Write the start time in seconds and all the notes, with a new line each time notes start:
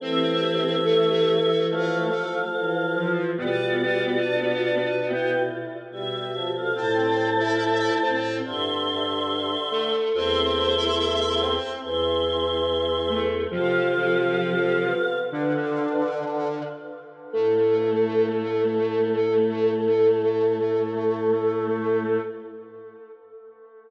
0.00 E3 A3 C4 G4 C5 E5
0.85 A3 A4
1.69 F3 A3 A4 F5
2.53 E3
2.96 F3 F4
3.38 B2 G3 B3 F4 B4 D5
4.23 D4
4.65 D4
5.07 E4 B4 G5
5.91 B2 G3 G4 E5
6.34 F3
6.55 A4 F5
6.75 A2 A3 C4 C5 A5
7.40 E4 E5
8.03 A2 C4 C5
8.45 G2 D3 E5 C6
9.71 A3 A4
10.13 E2 A3 C4 C5 E5 C6
10.77 E4 E5
11.41 C4 C5
11.83 E2 E3 E5 C6
13.10 A3 A4
13.51 C3 F3 C4 F4 A4 F5
13.95 C4
14.84 B3
15.31 D3 D4 B4
17.33 A2 A3 A4